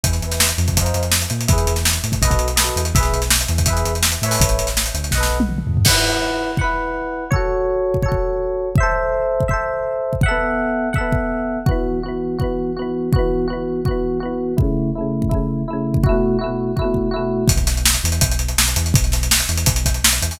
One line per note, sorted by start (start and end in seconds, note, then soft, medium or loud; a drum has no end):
0.03 0.19 E2 medium
0.03 0.16 E5 medium
0.03 0.16 G#5 medium
0.03 kick medium
0.03 closed hi-hat medium
0.09 0.16 B4 medium
0.13 snare soft
0.13 closed hi-hat medium
0.21 0.52 E2 medium
0.21 0.46 E5 medium
0.21 0.46 G#5 medium
0.21 closed hi-hat medium
0.26 0.46 B4 medium
0.31 snare medium
0.31 closed hi-hat medium
0.40 snare loud
0.49 closed hi-hat medium
0.58 0.92 F2 medium
0.58 closed hi-hat medium
0.68 kick medium
0.68 closed hi-hat medium
0.77 1.02 D#5 medium
0.77 1.02 F5 medium
0.77 kick medium
0.77 closed hi-hat loud
0.82 1.02 A#4 medium
0.82 1.02 C5 medium
0.86 closed hi-hat medium
0.94 1.25 F2 medium
0.94 closed hi-hat medium
1.03 closed hi-hat medium
1.12 snare loud
1.21 closed hi-hat medium
1.30 1.46 A#2 medium
1.30 closed hi-hat medium
1.41 closed hi-hat medium
1.48 1.64 E2 medium
1.48 1.73 B4 medium
1.48 1.73 E5 medium
1.48 kick loud
1.48 closed hi-hat medium
1.53 1.73 G#4 medium
1.58 closed hi-hat medium
1.67 1.98 E2 medium
1.67 closed hi-hat medium
1.76 snare medium
1.76 closed hi-hat medium
1.85 snare loud
1.93 closed hi-hat medium
2.03 2.19 A2 medium
2.03 closed hi-hat medium
2.12 kick medium
2.12 closed hi-hat medium
2.22 2.37 B1 medium
2.22 2.48 B4 medium
2.22 2.48 D#5 medium
2.22 kick medium
2.22 closed hi-hat loud
2.27 2.48 F#4 medium
2.27 2.48 A4 medium
2.27 kick medium
2.27 closed hi-hat medium
2.39 2.71 B1 medium
2.39 closed hi-hat medium
2.48 closed hi-hat medium
2.56 2.82 B4 medium
2.56 2.82 D#5 medium
2.56 snare loud
2.61 2.82 F#4 medium
2.61 2.82 A4 medium
2.66 closed hi-hat medium
2.76 2.92 E2 medium
2.76 closed hi-hat medium
2.85 closed hi-hat medium
2.94 3.10 B1 medium
2.94 3.20 B4 medium
2.94 3.20 E5 medium
2.94 kick loud
2.94 closed hi-hat medium
3.00 3.20 G#4 medium
3.00 closed hi-hat medium
3.05 snare soft
3.13 3.43 B1 medium
3.13 closed hi-hat medium
3.22 snare soft
3.22 closed hi-hat medium
3.30 snare loud
3.41 closed hi-hat medium
3.48 3.83 E2 medium
3.48 closed hi-hat medium
3.58 kick medium
3.58 closed hi-hat medium
3.66 3.93 E5 medium
3.66 kick medium
3.66 closed hi-hat medium
3.70 3.93 G#4 medium
3.70 3.93 B4 medium
3.77 closed hi-hat medium
3.85 4.16 E2 medium
3.85 closed hi-hat medium
3.95 closed hi-hat medium
4.03 snare loud
4.12 closed hi-hat medium
4.22 4.37 A2 medium
4.22 4.67 E5 medium
4.22 closed hi-hat medium
4.26 4.67 B4 medium
4.26 4.67 C#5 medium
4.31 4.67 A4 medium
4.31 open hi-hat medium
4.40 4.55 A1 medium
4.40 kick loud
4.40 closed hi-hat loud
4.49 closed hi-hat medium
4.58 4.89 A1 medium
4.58 closed hi-hat medium
4.67 snare medium
4.67 closed hi-hat medium
4.77 snare medium
4.86 closed hi-hat medium
4.94 5.10 D2 medium
4.94 closed hi-hat medium
5.04 closed hi-hat medium
5.11 5.28 B1 medium
5.11 5.38 D#5 medium
5.11 5.38 F#5 medium
5.11 kick medium
5.11 snare medium
5.18 5.38 A4 medium
5.18 5.38 B4 medium
5.23 snare medium
5.31 5.62 B1 medium
5.40 high tom medium
5.49 mid tom medium
5.58 mid tom medium
5.67 5.83 E2 medium
5.67 floor tom medium
5.77 floor tom loud
5.85 6.51 B4 medium
5.85 6.51 F#5 loud
5.85 kick loud
5.85 crash loud
5.91 6.51 E4 loud
6.57 7.24 B4 medium
6.57 7.24 F#5 medium
6.57 kick medium
6.64 7.24 E4 medium
7.31 7.96 A4 medium
7.31 7.96 C#5 loud
7.31 kick loud
7.36 7.96 F#4 loud
7.94 kick medium
8.02 8.69 A4 medium
8.02 8.69 C#5 medium
8.02 kick medium
8.08 8.69 F#4 medium
8.08 kick medium
8.75 9.43 E5 loud
8.75 kick loud
8.80 9.43 A4 loud
8.80 9.43 C5 loud
9.40 kick medium
9.48 10.14 C5 medium
9.48 10.14 E5 medium
9.48 kick medium
9.53 10.14 A4 medium
10.13 kick medium
10.21 10.89 F#5 loud
10.21 kick loud
10.26 10.89 A4 loud
10.26 10.89 E5 loud
10.31 10.89 B3 loud
10.93 11.58 E5 medium
10.93 11.58 F#5 medium
10.93 kick medium
10.98 11.58 B3 medium
10.98 11.58 A4 medium
11.12 kick medium
11.66 11.99 B3 medium
11.66 11.99 F#4 medium
11.66 kick loud
11.71 11.99 E3 loud
12.03 12.36 B3 medium
12.03 12.36 F#4 medium
12.08 12.36 E3 medium
12.38 12.71 B3 medium
12.38 12.71 F#4 medium
12.38 kick medium
12.44 12.71 E3 medium
12.77 13.09 B3 medium
12.77 13.09 F#4 medium
12.82 13.09 E3 medium
13.12 13.46 B3 loud
13.12 13.46 F#4 loud
13.12 kick loud
13.19 13.46 E3 loud
13.48 13.80 B3 medium
13.48 13.80 F#4 medium
13.53 13.80 E3 medium
13.85 14.18 B3 medium
13.85 14.18 F#4 medium
13.85 kick medium
13.91 14.18 E3 medium
14.20 14.53 B3 medium
14.20 14.53 F#4 medium
14.25 14.53 E3 medium
14.57 14.90 A3 medium
14.57 14.90 E4 loud
14.57 kick loud
14.62 14.90 C#3 loud
14.95 15.28 A3 medium
14.95 15.28 E4 medium
15.01 15.28 C#3 medium
15.22 kick medium
15.29 15.62 A3 medium
15.29 15.62 E4 medium
15.29 kick medium
15.35 15.62 C#3 medium
15.68 16.01 A3 medium
15.68 16.01 E4 medium
15.73 16.01 C#3 medium
15.94 kick medium
16.03 16.37 E4 medium
16.03 16.37 F#4 loud
16.03 kick loud
16.09 16.37 B2 loud
16.09 16.37 A3 loud
16.39 16.71 E4 medium
16.39 16.71 F#4 medium
16.44 16.71 B2 medium
16.44 16.71 A3 medium
16.76 17.09 E4 medium
16.76 17.09 F#4 medium
16.76 kick medium
16.82 17.09 B2 medium
16.82 17.09 A3 medium
16.94 kick medium
17.11 17.44 E4 medium
17.11 17.44 F#4 medium
17.16 17.44 B2 medium
17.16 17.44 A3 medium
17.48 17.95 B1 medium
17.48 kick loud
17.48 closed hi-hat loud
17.57 kick medium
17.57 closed hi-hat medium
17.67 snare medium
17.67 closed hi-hat medium
17.77 closed hi-hat medium
17.85 snare loud
17.94 closed hi-hat medium
18.04 18.19 E2 medium
18.04 closed hi-hat medium
18.12 closed hi-hat medium
18.21 18.53 B1 medium
18.21 kick medium
18.21 closed hi-hat loud
18.31 closed hi-hat medium
18.39 closed hi-hat medium
18.48 closed hi-hat medium
18.58 18.73 B1 medium
18.58 snare loud
18.68 closed hi-hat medium
18.76 18.92 E2 medium
18.76 closed hi-hat medium
18.86 closed hi-hat medium
18.94 19.41 B1 medium
18.94 kick loud
18.94 closed hi-hat loud
19.04 closed hi-hat medium
19.12 snare medium
19.12 closed hi-hat medium
19.23 closed hi-hat medium
19.31 snare loud
19.40 closed hi-hat medium
19.49 19.64 E2 medium
19.49 closed hi-hat medium
19.57 closed hi-hat medium
19.66 19.98 B1 medium
19.66 kick loud
19.66 closed hi-hat loud
19.76 closed hi-hat medium
19.86 kick medium
19.86 snare soft
19.86 closed hi-hat medium
19.94 closed hi-hat medium
20.04 20.19 B1 medium
20.04 snare loud
20.13 closed hi-hat medium
20.22 20.37 E2 medium
20.22 closed hi-hat medium
20.31 open hi-hat medium